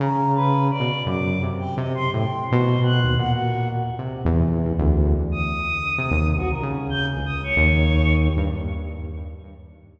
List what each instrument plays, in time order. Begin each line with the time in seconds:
0.00 lead 2 (sawtooth) C#3, choir aahs A#5
0.35 choir aahs B4
0.71 choir aahs D5
0.80 lead 2 (sawtooth) B2
1.06 lead 2 (sawtooth) F#2, choir aahs D6
1.42 lead 2 (sawtooth) C3
1.59 choir aahs G5
1.77 lead 2 (sawtooth) C3, choir aahs D#5
1.95 choir aahs C6
2.12 lead 2 (sawtooth) A2, choir aahs G5
2.48 lead 2 (sawtooth) B2, choir aahs C5
2.83 choir aahs F#6
3.04 lead 2 (sawtooth) D#2
3.18 lead 2 (sawtooth) A#2, choir aahs F#5
3.32 choir aahs F#4
3.98 lead 2 (sawtooth) C3
4.25 lead 2 (sawtooth) E2
4.78 lead 2 (sawtooth) D2
5.32 choir aahs D#6
5.98 lead 2 (sawtooth) C3
6.11 lead 2 (sawtooth) D#2
6.37 lead 2 (sawtooth) C2, choir aahs F#4
6.51 choir aahs A#4
6.62 lead 2 (sawtooth) C#3
6.90 choir aahs G6
7.08 choir aahs G#4
7.17 lead 2 (sawtooth) C#2
7.26 choir aahs D#6
7.44 choir aahs C#5
7.57 lead 2 (sawtooth) D#2
8.37 lead 2 (sawtooth) G2